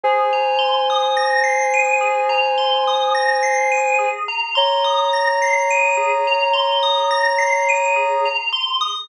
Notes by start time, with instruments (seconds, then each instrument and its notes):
0.03 tubular bells G#4, ocarina C5 G#5
0.33 tubular bells A#5
0.58 tubular bells C6
0.90 tubular bells D#6
1.17 tubular bells A#6
1.44 tubular bells C7
1.74 tubular bells D#7
2.01 tubular bells G#4
2.29 tubular bells A#5
2.58 tubular bells C6
2.87 tubular bells D#6
3.15 tubular bells A#6
3.43 tubular bells C7
3.71 tubular bells D#7
3.99 tubular bells G#4
4.28 tubular bells A#5
4.55 ocarina C#5 A#5, tubular bells C6
4.84 tubular bells D#6
5.13 tubular bells A#6
5.42 tubular bells C7
5.70 tubular bells D#7
5.97 tubular bells G#4
6.27 tubular bells A#5
6.53 tubular bells C6
6.83 tubular bells D#6
7.11 tubular bells A#6
7.38 tubular bells C7
7.69 tubular bells D#7
7.96 tubular bells G#4
8.25 tubular bells A#5
8.53 tubular bells C6
8.81 tubular bells D#6